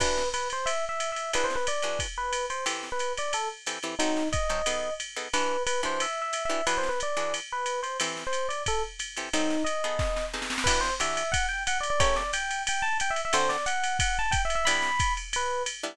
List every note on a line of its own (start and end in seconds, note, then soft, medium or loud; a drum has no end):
0.00 0.23 E3 loud
0.00 0.23 D4 loud
0.00 0.23 F#4 loud
0.00 0.23 G4 loud
0.00 0.29 B4 loud
0.00 kick medium
0.00 crash loud
0.00 ride loud
0.17 snare medium
0.34 0.48 B4 loud
0.34 hi-hat pedal loud
0.34 ride medium
0.50 0.69 C5 loud
0.50 ride medium
0.66 0.85 E5 medium
0.66 ride loud
0.89 1.11 E5 medium
1.00 hi-hat pedal medium
1.00 ride medium
1.12 1.31 E5 medium
1.16 ride medium
1.33 1.57 E3 loud
1.33 1.57 D4 loud
1.33 1.57 F#4 medium
1.33 1.57 G#4 loud
1.33 1.46 B4 loud
1.33 ride loud
1.44 1.55 C5 medium
1.50 snare medium
1.56 1.66 B4 medium
1.67 1.98 D5 medium
1.67 hi-hat pedal loud
1.67 ride loud
1.82 2.07 E3 medium
1.82 2.07 D4 medium
1.82 2.07 F#4 medium
1.82 2.07 G#4 medium
1.82 ride medium
1.99 kick medium
1.99 ride loud
2.18 2.46 B4 loud
2.33 hi-hat pedal medium
2.33 ride loud
2.50 2.65 C5 medium
2.50 ride medium
2.66 2.89 E3 loud
2.66 2.89 C4 loud
2.66 2.89 G4 loud
2.66 2.89 A4 loud
2.66 ride loud
2.83 snare medium
2.92 3.13 B4 medium
2.99 hi-hat pedal medium
2.99 ride medium
3.17 3.32 D5 medium
3.17 ride medium
3.33 3.48 A4 loud
3.33 ride loud
3.66 3.79 E3 medium
3.66 3.79 C4 medium
3.66 3.79 G4 medium
3.66 3.79 A4 medium
3.66 hi-hat pedal loud
3.66 ride loud
3.83 3.95 E3 medium
3.83 3.95 C4 medium
3.83 3.95 G4 medium
3.83 3.95 A4 medium
3.83 ride medium
3.99 4.23 F#3 loud
3.99 4.23 C4 loud
3.99 4.28 D#4 loud
3.99 4.23 D#4 loud
3.99 4.23 A4 loud
3.99 ride loud
4.17 snare medium
4.32 4.94 D#5 medium
4.32 kick medium
4.32 hi-hat pedal loud
4.32 ride loud
4.49 4.62 F#3 medium
4.49 4.62 C4 medium
4.49 4.62 D#4 medium
4.49 4.62 A4 medium
4.49 ride medium
4.66 4.90 B3 loud
4.66 4.90 D#4 medium
4.66 4.90 G#4 medium
4.66 4.90 A4 loud
4.66 ride loud
5.00 hi-hat pedal medium
5.00 ride medium
5.16 5.28 B3 medium
5.16 5.28 D#4 medium
5.16 5.28 G#4 medium
5.16 5.28 A4 medium
5.16 ride medium
5.33 5.57 E3 loud
5.33 5.57 D4 loud
5.33 5.57 F#4 loud
5.33 5.57 G4 loud
5.33 5.63 B4 loud
5.33 ride loud
5.67 5.81 B4 loud
5.67 hi-hat pedal loud
5.67 ride loud
5.83 6.06 E3 medium
5.83 6.06 D4 medium
5.83 6.06 F#4 medium
5.83 6.06 G4 medium
5.83 6.02 C5 loud
5.83 ride medium
6.00 6.21 E5 medium
6.00 ride loud
6.22 6.43 E5 medium
6.33 hi-hat pedal loud
6.33 ride loud
6.45 6.65 E5 medium
6.50 6.61 E3 loud
6.50 6.61 D4 medium
6.50 6.61 F#4 medium
6.50 6.61 G4 medium
6.50 ride medium
6.67 6.90 E3 loud
6.67 6.90 D4 loud
6.67 6.90 F#4 loud
6.67 6.90 G#4 loud
6.67 6.77 B4 loud
6.67 ride loud
6.78 6.88 C5 medium
6.83 snare medium
6.89 6.99 B4 medium
7.00 7.33 D5 medium
7.00 hi-hat pedal loud
7.00 ride medium
7.17 7.40 E3 medium
7.17 7.40 D4 medium
7.17 7.40 F#4 medium
7.17 7.40 G#4 medium
7.17 ride medium
7.34 ride loud
7.52 7.80 B4 loud
7.66 hi-hat pedal medium
7.66 ride medium
7.83 7.97 C5 medium
7.83 ride medium
8.00 8.24 E3 loud
8.00 8.24 C4 loud
8.00 8.24 G4 medium
8.00 8.24 A4 loud
8.00 ride loud
8.17 snare medium
8.27 8.47 C5 medium
8.33 hi-hat pedal medium
8.33 ride medium
8.49 8.63 D5 medium
8.49 ride medium
8.66 8.82 A4 loud
8.66 kick medium
8.66 ride loud
8.99 hi-hat pedal medium
8.99 ride loud
9.17 9.29 E3 medium
9.17 9.29 C4 medium
9.17 9.29 G4 medium
9.17 9.29 A4 medium
9.17 ride medium
9.33 9.57 F#3 loud
9.33 9.57 C4 loud
9.33 9.57 D#4 loud
9.33 9.63 D#4 loud
9.33 9.57 A4 loud
9.33 ride loud
9.50 snare medium
9.64 10.26 D#5 medium
9.64 hi-hat pedal medium
9.64 ride medium
9.84 10.24 B3 loud
9.84 10.24 D#4 loud
9.84 10.24 G#4 loud
9.84 10.24 A4 medium
9.84 ride medium
9.99 kick medium
9.99 snare medium
10.16 snare medium
10.34 10.57 B3 medium
10.34 10.57 D#4 loud
10.34 10.57 G#4 medium
10.34 10.57 A4 medium
10.34 snare medium
10.42 snare medium
10.50 snare loud
10.58 snare loud
10.64 10.90 E3 loud
10.64 10.90 D4 loud
10.64 10.90 F#4 loud
10.64 10.90 G4 loud
10.64 10.80 B4 loud
10.64 kick medium
10.64 crash loud
10.64 ride loud
10.81 10.94 C5 loud
10.81 snare medium
11.00 11.23 E3 medium
11.00 11.23 D4 loud
11.00 11.23 F#4 medium
11.00 11.23 G4 loud
11.00 11.31 E5 medium
11.00 hi-hat pedal loud
11.00 ride loud
11.17 ride loud
11.32 11.46 F#5 loud
11.32 kick medium
11.32 ride loud
11.49 11.63 G5 loud
11.67 11.78 F#5 loud
11.67 hi-hat pedal loud
11.67 ride loud
11.80 11.90 D5 medium
11.80 ride medium
11.90 12.01 D5 loud
12.00 12.23 A3 loud
12.00 12.23 C#4 loud
12.00 12.23 G4 loud
12.00 12.23 A#4 loud
12.00 12.15 C#5 loud
12.00 kick medium
12.00 ride loud
12.16 12.31 D5 loud
12.16 snare medium
12.33 12.62 G5 medium
12.33 hi-hat pedal loud
12.33 ride loud
12.51 ride medium
12.67 12.83 G5 medium
12.67 ride loud
12.82 12.97 A5 loud
13.00 13.12 G5 loud
13.00 hi-hat pedal loud
13.00 ride loud
13.10 13.21 E5 loud
13.16 ride medium
13.25 13.35 E5 loud
13.33 13.57 D3 loud
13.33 13.57 C4 loud
13.33 13.57 F#4 loud
13.33 13.57 A4 loud
13.33 13.49 C5 loud
13.33 ride loud
13.49 13.65 D5 loud
13.49 snare medium
13.66 13.97 F#5 loud
13.66 hi-hat pedal loud
13.66 ride medium
13.84 ride loud
13.99 14.17 F#5 medium
13.99 kick medium
13.99 ride loud
14.19 14.33 A5 loud
14.31 14.42 G5 loud
14.31 kick medium
14.31 hi-hat pedal medium
14.31 ride loud
14.45 14.55 E5 medium
14.50 ride medium
14.55 14.66 E5 loud
14.65 14.90 G3 loud
14.65 14.90 B3 loud
14.65 14.90 D4 loud
14.65 14.90 E4 loud
14.65 15.13 B5 loud
14.65 ride loud
14.82 snare medium
14.99 kick medium
14.99 hi-hat pedal medium
14.99 ride loud
15.17 ride medium
15.33 15.63 B4 loud
15.33 ride loud
15.66 hi-hat pedal loud
15.66 ride loud
15.83 15.95 G3 medium
15.83 15.95 B3 loud
15.83 15.95 D4 loud
15.83 15.95 E4 loud
15.83 ride medium